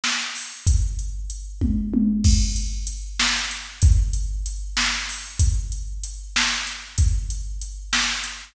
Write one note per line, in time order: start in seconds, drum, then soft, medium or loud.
0.04 snare loud
0.35 open hi-hat medium
0.67 kick loud
0.67 closed hi-hat loud
0.99 closed hi-hat medium
1.30 closed hi-hat medium
1.61 kick medium
1.61 high tom loud
1.94 high tom loud
2.24 kick loud
2.24 crash loud
2.56 closed hi-hat medium
2.87 closed hi-hat loud
3.19 snare loud
3.51 closed hi-hat medium
3.82 kick loud
3.82 closed hi-hat loud
4.13 closed hi-hat medium
4.46 closed hi-hat medium
4.77 snare loud
5.09 open hi-hat medium
5.39 kick loud
5.39 closed hi-hat loud
5.72 closed hi-hat medium
6.04 closed hi-hat loud
6.36 snare loud
6.67 closed hi-hat medium
6.98 kick loud
6.98 closed hi-hat loud
7.30 closed hi-hat medium
7.61 closed hi-hat medium
7.93 snare loud
8.24 closed hi-hat medium